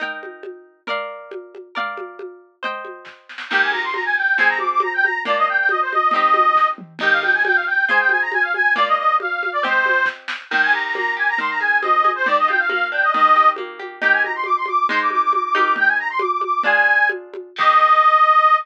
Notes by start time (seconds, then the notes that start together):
0.00 D#4 A#4 G5, low conga
0.23 high conga
0.43 high conga
0.87 A#4 D5 F5, low conga
1.31 high conga
1.55 high conga
1.75 A#4 D5 F5, low conga
1.97 high conga
2.19 high conga
2.63 C5 D#5 G5, low conga
2.85 high conga
3.05 kick, snare
3.29 snare
3.38 snare
3.50 D#3 A#3 G4 G5, crash, low conga
3.61 G#5
3.72 A#5, high conga
3.84 C6
3.93 A#5, high conga
4.05 G#5
4.16 G5
4.37 F3 C4 G#4 G#5, low conga
4.48 A#5
4.59 D6, high conga
4.71 D6
4.80 A#5, high conga
4.94 G5
5.03 A#5, high conga
5.25 A#3 D4 F4 D5, low conga
5.37 D#5
5.48 G5
5.58 G5
5.69 D#5, high conga
5.81 C5
5.92 D#5, high conga
6.11 C4 D#4 D#5, low conga
6.16 G4
6.34 high conga
6.56 kick, snare
6.78 mid tom
6.99 D#4 G4 G5, crash, low conga
7.03 A#4
7.11 F5
7.22 G5, high conga
7.34 G#5
7.45 G5, high conga
7.55 F5
7.67 G5
7.89 F4 G#4 C5 G#5, low conga
7.99 G5
8.09 G#5, high conga
8.22 A#5
8.32 G#5, high conga
8.42 F5
8.54 G#5, high conga
8.76 A#3 F4 D5, low conga
8.87 D#5
8.97 D#5
9.20 F5, high conga
9.43 high conga
9.52 D5
9.63 C4 G4 C5 D#5, low conga
9.86 high conga
10.06 kick, snare
10.28 snare
10.50 D#3 G5, crash, low conga
10.62 G#5
10.73 G4 A#5
10.84 A#5
10.95 A#3 A#5, high conga
11.17 G4 G#5
11.28 A#5
11.38 D#3 C6, low conga
11.49 A#5
11.60 G#4 G#5
11.82 C4 D#5, high conga
12.04 G#4, high conga
12.15 C5
12.26 D#3 D5, low conga
12.38 D#5
12.48 F4 G5, high conga
12.59 F5
12.69 A#3 F5, high conga
12.92 D4 G5
13.02 D#5
13.14 D#3 D#5, low conga
13.36 G4
13.56 A#3, high conga
13.79 G4, high conga
14.02 D#4 G4 A#4 G5, low conga
14.12 G#5
14.23 A#5, high conga
14.35 C6
14.44 D6, high conga
14.56 C6
14.66 D6, high conga
14.89 G#3 D#4 C5 C6, low conga
15.01 D6
15.10 D6, high conga
15.22 D6
15.33 D6, high conga
15.43 D6
15.54 D#4 G4 A#4 D6, high conga
15.76 G5, low conga
15.87 G#5
15.98 A#5
16.10 C6
16.19 D6, high conga
16.31 D6
16.41 D6, high conga
16.63 D4 F4 G#4 G#5, low conga
17.09 high conga
17.34 high conga
17.56 D#3 A#3 D#5, kick, crash
17.61 G4